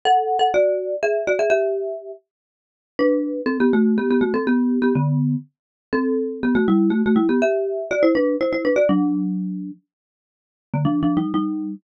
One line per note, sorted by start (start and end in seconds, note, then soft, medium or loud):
0.05 0.37 A4 loud
0.05 0.37 F#5 loud
0.39 0.51 A4 medium
0.39 0.51 F#5 loud
0.54 0.95 F#4 loud
0.54 0.95 D5 loud
1.03 1.27 G#4 medium
1.03 1.27 E5 loud
1.27 1.39 F#4 medium
1.27 1.39 D5 loud
1.39 1.51 G#4 medium
1.39 1.49 E5 loud
1.50 2.11 G4 loud
1.50 2.11 E5 loud
2.99 3.41 D4 loud
2.99 3.41 B4 loud
3.46 3.58 C4 loud
3.46 3.58 A4 loud
3.60 3.72 B3 loud
3.60 3.72 G4 loud
3.73 3.97 A3 loud
3.73 3.97 F#4 loud
3.98 4.09 B3 medium
3.98 4.09 G4 loud
4.11 4.22 B3 medium
4.11 4.22 G4 loud
4.21 4.33 A3 medium
4.21 4.33 F#4 loud
4.34 4.45 C4 medium
4.34 4.45 A4 loud
4.47 4.79 B3 loud
4.47 4.79 G4 loud
4.82 4.94 B3 medium
4.82 4.94 G4 loud
4.95 5.35 D3 medium
4.95 5.35 B3 loud
5.93 6.40 C4 loud
5.93 6.40 A4 loud
6.43 6.55 B3 medium
6.43 6.55 G4 loud
6.55 6.67 A3 loud
6.55 6.67 F#4 loud
6.68 6.90 G3 loud
6.68 6.90 E4 loud
6.90 7.02 A3 medium
6.90 7.02 F#4 loud
7.06 7.18 A3 medium
7.06 7.18 F#4 loud
7.16 7.27 G3 loud
7.16 7.27 E4 loud
7.29 7.41 B3 medium
7.29 7.41 G4 loud
7.42 7.89 G4 loud
7.42 7.89 E5 loud
7.91 8.03 F#4 loud
7.91 8.03 D5 loud
8.03 8.14 E4 loud
8.03 8.14 C5 loud
8.15 8.36 D4 loud
8.15 8.36 B4 loud
8.41 8.52 E4 medium
8.41 8.52 C5 loud
8.53 8.64 E4 medium
8.53 8.64 C5 medium
8.65 8.76 D4 medium
8.65 8.76 B4 loud
8.76 8.88 F#4 medium
8.76 8.88 D5 loud
8.89 9.71 F#3 loud
8.89 9.71 D4 loud
10.74 10.85 D3 medium
10.74 10.85 A#3 medium
10.85 11.01 F3 medium
10.85 11.01 D4 loud
11.03 11.18 F3 medium
11.03 11.18 D4 loud
11.17 11.32 G3 medium
11.17 11.32 D#4 medium
11.34 11.75 G3 medium
11.34 11.75 D#4 loud